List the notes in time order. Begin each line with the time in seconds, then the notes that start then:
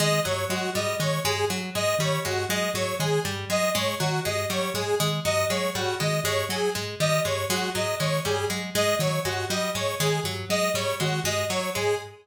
0.00 D#3 G#3 D#5
0.25 G2 F#3 C#5
0.49 F#3 G#3 F#4
0.75 G#2 G3 D#5
1.00 D#3 G#3 C#5
1.24 G2 G#3 G#4
1.50 F#3
1.75 G#2 G#3 D#5
1.99 D#3 G3 C#5
2.25 G2 G#3 F#4
2.49 F#3 G#3 D#5
2.74 G#2 F#3 C#5
3.00 D#3 G#3 G#4
3.25 G2 G3
3.50 F#3 G#3 D#5
3.75 G#2 G#3 C#5
4.00 D#3 F#3 F#4
4.25 G2 G#3 D#5
4.50 F#3 G3 C#5
4.74 G#2 G#3 G#4
5.00 D#3 G#3
5.25 G2 F#3 D#5
5.50 F#3 G#3 C#5
5.75 G#2 G3 F#4
6.00 D#3 G#3 D#5
6.24 G2 G#3 C#5
6.49 F#3 G#4
6.75 G#2 G#3
7.00 D#3 G3 D#5
7.25 G2 G#3 C#5
7.50 F#3 G#3 F#4
7.75 G#2 F#3 D#5
8.00 D#3 G#3 C#5
8.25 G2 G3 G#4
8.50 F#3 G#3
8.75 G#2 G#3 D#5
8.99 D#3 F#3 C#5
9.25 G2 G#3 F#4
9.50 F#3 G3 D#5
9.75 G#2 G#3 C#5
10.00 D#3 G#3 G#4
10.24 G2 F#3
10.50 F#3 G#3 D#5
10.74 G#2 G3 C#5
11.00 D#3 G#3 F#4
11.24 G2 G#3 D#5
11.50 F#3 C#5
11.75 G#2 G#3 G#4